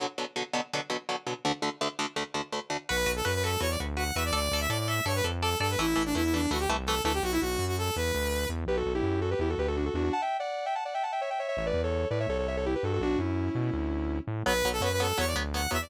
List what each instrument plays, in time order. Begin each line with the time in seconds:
0.00 overdriven guitar B2 D3 F#3
0.18 overdriven guitar B2 D3 F#3
0.36 overdriven guitar B2 D3 F#3
0.53 overdriven guitar B2 D3 F#3
0.73 overdriven guitar B2 D3 F#3
0.90 overdriven guitar B2 D3 F#3
1.09 overdriven guitar B2 D3 F#3
1.27 overdriven guitar B2 D3 F#3
1.45 overdriven guitar D2 D3 A3
1.62 overdriven guitar D2 D3 A3
1.81 overdriven guitar D2 D3 A3
1.99 overdriven guitar D2 D3 A3
2.16 overdriven guitar D2 D3 A3
2.34 overdriven guitar D2 D3 A3
2.52 overdriven guitar D2 D3 A3
2.70 overdriven guitar D2 D3 A3
2.89 synth bass 1 B1, overdriven guitar F#4 B4, lead 2 (sawtooth) B4
3.06 synth bass 1 B1, overdriven guitar F#4 B4
3.16 lead 2 (sawtooth) A4
3.25 synth bass 1 F#2, overdriven guitar F#4 B4, lead 2 (sawtooth) B4
3.34 lead 2 (sawtooth) B4
3.43 overdriven guitar F#4 B4, lead 2 (sawtooth) A4
3.60 synth bass 1 E2, overdriven guitar F#4 B4, lead 2 (sawtooth) C#5
3.70 lead 2 (sawtooth) D5
3.80 synth bass 1 D2, overdriven guitar F#4 B4
3.97 overdriven guitar F#4 B4, lead 2 (sawtooth) F#5
4.15 synth bass 1 E2, overdriven guitar F#4 B4, lead 2 (sawtooth) E5
4.25 lead 2 (sawtooth) D5
4.33 synth bass 1 D2, overdriven guitar A4 D5, lead 2 (sawtooth) D5
4.51 synth bass 1 D2, overdriven guitar A4 D5
4.61 lead 2 (sawtooth) E5
4.69 synth bass 1 A2, overdriven guitar A4 D5, lead 2 (sawtooth) D5
4.79 lead 2 (sawtooth) D5
4.88 overdriven guitar A4 D5, lead 2 (sawtooth) E5
5.05 synth bass 1 G2, overdriven guitar A4 D5, lead 2 (sawtooth) C#5
5.16 lead 2 (sawtooth) B4
5.24 synth bass 1 F2, overdriven guitar A4 D5
5.42 lead 2 (sawtooth) A4, overdriven guitar A4 D5
5.60 synth bass 1 G2, overdriven guitar A4 D5, lead 2 (sawtooth) A4
5.70 lead 2 (sawtooth) B4
5.78 synth bass 1 A1, overdriven guitar E3 A3, lead 2 (sawtooth) E4
5.96 synth bass 1 A1, overdriven guitar E3 A3
6.05 lead 2 (sawtooth) D4
6.15 synth bass 1 E2, overdriven guitar E3 A3, lead 2 (sawtooth) E4
6.24 lead 2 (sawtooth) E4
6.33 overdriven guitar E3 A3, lead 2 (sawtooth) D4
6.50 synth bass 1 D2, overdriven guitar E3 A3, lead 2 (sawtooth) F#4
6.59 lead 2 (sawtooth) G4
6.69 synth bass 1 C2, overdriven guitar E3 A3
6.86 overdriven guitar E3 A3, lead 2 (sawtooth) A4
7.04 synth bass 1 D2, overdriven guitar E3 A3, lead 2 (sawtooth) A4
7.14 lead 2 (sawtooth) G4
7.23 synth bass 1 B1, lead 2 (sawtooth) F#4
7.32 lead 2 (sawtooth) E4
7.41 synth bass 1 B1, lead 2 (sawtooth) F#4
7.59 synth bass 1 F#2
7.67 lead 2 (sawtooth) F#4
7.78 lead 2 (sawtooth) A4
7.96 synth bass 1 E2, lead 2 (sawtooth) B4
8.15 synth bass 1 D2
8.49 synth bass 1 E2
8.67 synth bass 1 B1, distortion guitar G4 B4
8.77 distortion guitar F#4 A4
8.86 synth bass 1 B1
8.95 distortion guitar E4 G4
9.03 synth bass 1 F#2
9.21 distortion guitar F#4 A4
9.31 distortion guitar G4 B4
9.39 synth bass 1 E2, distortion guitar E4 G4
9.50 distortion guitar F#4 A4
9.58 synth bass 1 D2, distortion guitar G4 B4
9.68 distortion guitar F#4 A4
9.77 distortion guitar D4 F#4
9.86 distortion guitar F#4 A4
9.94 synth bass 1 E2, distortion guitar D4 F#4
10.04 distortion guitar D4 F#4
10.13 distortion guitar F#5 A5
10.22 distortion guitar E5 G5
10.39 distortion guitar D5 F#5
10.66 distortion guitar E5 G5
10.75 distortion guitar F#5 A5
10.85 distortion guitar D5 F#5
10.94 distortion guitar E5 G5
11.03 distortion guitar F#5 A5
11.12 distortion guitar E5 G5
11.21 distortion guitar C#5 E5
11.30 distortion guitar E5 G5
11.39 distortion guitar C#5 E5
11.48 distortion guitar C#5 E5
11.57 synth bass 1 A1, distortion guitar C#5 E5
11.66 distortion guitar B4 D5
11.74 synth bass 1 E2
11.83 distortion guitar A4 C#5
12.10 synth bass 1 A2, distortion guitar B4 D5
12.20 distortion guitar C#5 E5
12.29 synth bass 1 C2, distortion guitar A4 C#5
12.39 distortion guitar A4 C#5
12.48 distortion guitar C#5 E5
12.57 distortion guitar A4 C#5
12.66 distortion guitar E4 G4
12.75 distortion guitar G4 B4
12.83 synth bass 1 G2, distortion guitar F#4 A4
12.93 distortion guitar F#4 A4
13.00 synth bass 1 B1, distortion guitar D4 F#4
13.18 synth bass 1 F#2, distortion guitar C#4 E4
13.55 synth bass 1 B2
13.73 synth bass 1 D2
14.27 synth bass 1 A2
14.46 synth bass 1 B1, overdriven guitar F#3 B3, lead 2 (sawtooth) B4
14.65 synth bass 1 B1, overdriven guitar F#3 B3
14.73 lead 2 (sawtooth) A4
14.81 synth bass 1 F#2, overdriven guitar F#3 B3, lead 2 (sawtooth) B4
14.92 lead 2 (sawtooth) B4
15.00 overdriven guitar F#3 B3, lead 2 (sawtooth) A4
15.18 synth bass 1 E2, overdriven guitar F#3 B3, lead 2 (sawtooth) C#5
15.27 lead 2 (sawtooth) D5
15.36 synth bass 1 D2, overdriven guitar F#3 B3
15.54 overdriven guitar F#3 B3, lead 2 (sawtooth) F#5
15.71 synth bass 1 E2, overdriven guitar F#3 B3, lead 2 (sawtooth) E5
15.82 lead 2 (sawtooth) D5